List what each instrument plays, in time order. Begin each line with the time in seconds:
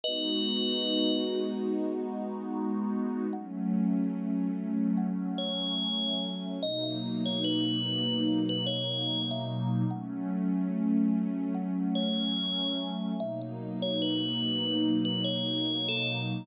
0.04 pad 2 (warm) G#3 B3 D#4 F#4, tubular bells B4 D#5
3.33 pad 2 (warm) F#3 A3 C#4, tubular bells F#5
4.98 tubular bells F#5
5.38 tubular bells C#5
6.61 pad 2 (warm) B2 F#3 A#3 D#4, tubular bells D#5
6.84 tubular bells E5
7.26 tubular bells C#5
7.44 tubular bells B4
8.49 tubular bells B4
8.67 tubular bells C#5
9.31 tubular bells E5
9.91 pad 2 (warm) F#3 A3 C#4, tubular bells F#5
11.55 tubular bells F#5
11.95 tubular bells C#5
13.19 pad 2 (warm) B2 F#3 A#3 D#4, tubular bells E5
13.42 tubular bells E5
13.82 tubular bells C#5
14.02 tubular bells B4
15.05 tubular bells B4
15.24 tubular bells C#5
15.89 tubular bells A4